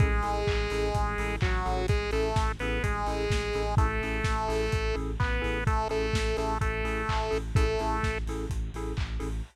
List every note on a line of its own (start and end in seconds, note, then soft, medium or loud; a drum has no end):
0.00 0.21 A1 medium
0.00 1.36 G#3 loud
0.00 0.08 C#4 loud
0.00 0.08 E4 loud
0.00 0.08 G#4 loud
0.00 1.36 G#4 loud
0.00 0.08 A4 loud
0.00 kick loud
0.00 closed hi-hat loud
0.23 0.44 A1 medium
0.23 0.40 C#4 loud
0.23 0.40 E4 medium
0.23 0.40 G#4 medium
0.23 0.40 A4 medium
0.23 open hi-hat medium
0.47 0.67 A1 medium
0.47 kick medium
0.47 clap loud
0.70 0.91 A1 medium
0.70 0.88 C#4 medium
0.70 0.88 E4 medium
0.70 0.88 G#4 loud
0.70 0.88 A4 medium
0.70 open hi-hat loud
0.94 1.15 A1 medium
0.94 kick medium
0.94 closed hi-hat loud
1.18 1.38 A1 medium
1.18 1.36 C#4 loud
1.18 1.36 E4 loud
1.18 1.36 G#4 loud
1.18 1.36 A4 loud
1.18 open hi-hat medium
1.41 1.63 A1 medium
1.41 1.87 F#3 medium
1.41 1.87 F#4 loud
1.41 kick loud
1.41 clap loud
1.65 1.86 A1 medium
1.65 1.82 C#4 loud
1.65 1.82 E4 medium
1.65 1.82 G#4 loud
1.65 1.82 A4 loud
1.65 open hi-hat medium
1.88 2.09 A1 medium
1.88 2.11 G#3 loud
1.88 2.11 G#4 loud
1.88 kick loud
1.88 closed hi-hat loud
2.11 2.33 A1 medium
2.11 2.52 A3 medium
2.11 2.29 C#4 loud
2.11 2.29 E4 loud
2.11 2.29 G#4 loud
2.11 2.29 A4 medium
2.11 2.52 A4 loud
2.11 open hi-hat medium
2.36 2.56 A1 medium
2.36 kick loud
2.36 snare loud
2.59 2.80 A1 medium
2.59 2.83 B3 loud
2.59 2.78 C#4 medium
2.59 2.78 E4 medium
2.59 2.78 G#4 medium
2.59 2.78 A4 loud
2.59 2.83 B4 loud
2.59 open hi-hat medium
2.83 3.04 A1 medium
2.83 3.75 G#3 medium
2.83 3.75 G#4 loud
2.83 kick medium
2.83 closed hi-hat loud
3.06 3.27 A1 medium
3.06 3.24 C#4 loud
3.06 3.24 E4 loud
3.06 3.24 G#4 loud
3.06 3.24 A4 loud
3.06 open hi-hat medium
3.30 3.50 A1 medium
3.30 kick medium
3.30 snare loud
3.53 3.75 A1 medium
3.53 3.63 C#4 medium
3.53 3.63 E4 loud
3.53 3.63 G#4 loud
3.53 3.63 A4 medium
3.53 open hi-hat medium
3.77 3.98 A1 medium
3.77 4.96 A3 loud
3.77 3.86 C#4 loud
3.77 3.86 E4 loud
3.77 3.86 G#4 loud
3.77 3.86 A4 loud
3.77 4.96 A4 loud
3.77 kick loud
3.77 closed hi-hat loud
4.01 4.21 A1 medium
4.01 4.19 C#4 loud
4.01 4.19 E4 medium
4.01 4.19 G#4 medium
4.01 4.19 A4 loud
4.01 open hi-hat medium
4.24 4.46 A1 medium
4.24 kick medium
4.24 snare loud
4.48 4.69 A1 medium
4.48 4.64 C#4 medium
4.48 4.64 E4 loud
4.48 4.64 G#4 loud
4.48 4.64 A4 medium
4.48 open hi-hat loud
4.72 4.93 A1 medium
4.72 kick medium
4.72 closed hi-hat loud
4.94 5.16 A1 medium
4.94 5.11 C#4 loud
4.94 5.11 E4 medium
4.94 5.11 G#4 loud
4.94 5.11 A4 loud
4.94 open hi-hat medium
5.20 5.40 A1 medium
5.20 5.64 B3 loud
5.20 5.64 B4 loud
5.20 kick loud
5.20 clap loud
5.41 5.64 A1 medium
5.41 5.58 C#4 loud
5.41 5.58 E4 loud
5.41 5.58 G#4 medium
5.41 5.58 A4 loud
5.41 open hi-hat medium
5.67 5.87 A1 medium
5.67 5.88 A3 loud
5.67 5.88 A4 loud
5.67 kick loud
5.67 closed hi-hat loud
5.89 6.11 A1 medium
5.89 6.37 A3 medium
5.89 6.06 C#4 loud
5.89 6.06 E4 loud
5.89 6.06 G#4 loud
5.89 6.06 A4 loud
5.89 6.37 A4 loud
5.89 open hi-hat medium
6.13 6.34 A1 medium
6.13 kick medium
6.13 snare loud
6.37 6.58 A1 medium
6.37 6.58 A3 medium
6.37 6.53 C#4 medium
6.37 6.53 E4 medium
6.37 6.53 G#4 loud
6.37 6.53 A4 loud
6.37 6.58 A4 medium
6.37 open hi-hat medium
6.61 6.82 A1 medium
6.61 7.38 A3 loud
6.61 7.38 A4 loud
6.61 kick medium
6.61 closed hi-hat loud
6.84 7.04 A1 medium
6.84 7.01 C#4 loud
6.84 7.01 E4 medium
6.84 7.01 G#4 loud
6.84 7.01 A4 loud
6.84 open hi-hat medium
7.09 7.29 A1 medium
7.09 kick medium
7.09 clap loud
7.31 7.52 A1 medium
7.31 7.39 C#4 medium
7.31 7.39 E4 medium
7.31 7.39 G#4 medium
7.31 7.39 A4 loud
7.31 open hi-hat medium
7.55 7.76 A1 medium
7.55 8.18 A3 loud
7.55 7.64 C#4 loud
7.55 7.64 E4 loud
7.55 7.64 G#4 loud
7.55 7.64 A4 loud
7.55 8.18 A4 loud
7.55 kick loud
7.55 closed hi-hat loud
7.79 8.00 A1 medium
7.79 7.97 C#4 loud
7.79 7.97 E4 loud
7.79 7.97 G#4 medium
7.79 7.97 A4 loud
7.79 open hi-hat medium
8.03 8.24 A1 medium
8.03 kick medium
8.03 snare medium
8.26 8.46 A1 medium
8.26 8.45 C#4 medium
8.26 8.45 E4 loud
8.26 8.45 G#4 medium
8.26 8.45 A4 loud
8.26 open hi-hat medium
8.50 8.70 A1 medium
8.50 kick medium
8.50 closed hi-hat loud
8.74 8.94 A1 medium
8.74 8.92 C#4 loud
8.74 8.92 E4 loud
8.74 8.92 G#4 loud
8.74 8.92 A4 loud
8.74 open hi-hat medium
8.97 9.18 A1 medium
8.97 kick medium
8.97 clap loud
9.20 9.42 A1 medium
9.20 9.28 C#4 medium
9.20 9.28 E4 medium
9.20 9.28 G#4 loud
9.20 9.28 A4 loud
9.20 open hi-hat medium